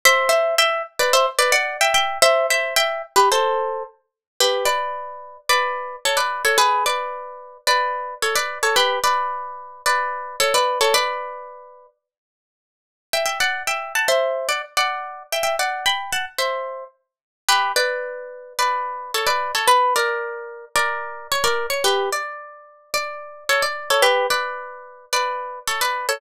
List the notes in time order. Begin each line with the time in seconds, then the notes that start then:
0.05 C5 E5
0.29 C5 E5
0.58 E5 G5
0.99 B4 D5
1.13 C5 E5
1.39 B4 D5
1.52 D5 F#5
1.81 E5 G5
1.94 E5 G5
2.22 C5 E5
2.50 C5 E5
2.76 E5 G5
3.16 G4 B4
3.32 A4 C5
4.40 G4 B4
4.65 B4 D5
5.49 B4 D5
6.05 A4 C#5
6.17 B4 D5
6.45 A4 C#5
6.58 G#4 B4
6.86 B4 D5
7.67 B4 D5
8.22 A4 C#5
8.35 B4 D5
8.63 A4 C#5
8.76 G4 B4
9.04 B4 D5
9.86 B4 D5
10.40 A4 C#5
10.54 B4 D5
10.81 A4 C#5
10.94 B4 D5
13.13 E5 G5
13.26 E5 G5
13.40 D5 F#5
13.67 E5 G5
13.95 F#5 A5
14.08 C5 E5
14.49 D5 F#5
14.77 D5 F#5
15.32 E5 G5
15.43 E5 G5
15.59 D5 F#5
15.86 G5 B5
16.13 F#5 A5
16.38 C5 E5
17.49 G4 B4
17.76 B4 D5
18.59 B4 D5
19.14 A4 C#5
19.27 B4 D5
19.55 A4 C#5
19.68 B4
19.96 A#4 D5
20.76 A#4 D5
21.32 C#5
21.44 A#4 D5
21.70 C#5
21.84 G4 B4
22.13 D5
22.94 D5
23.49 A4 C#5
23.62 D5
23.90 A4 C#5
24.02 G4 B4
24.30 B4 D5
25.13 B4 D5
25.68 A4 C#5
25.81 B4 D5
26.09 A4 C#5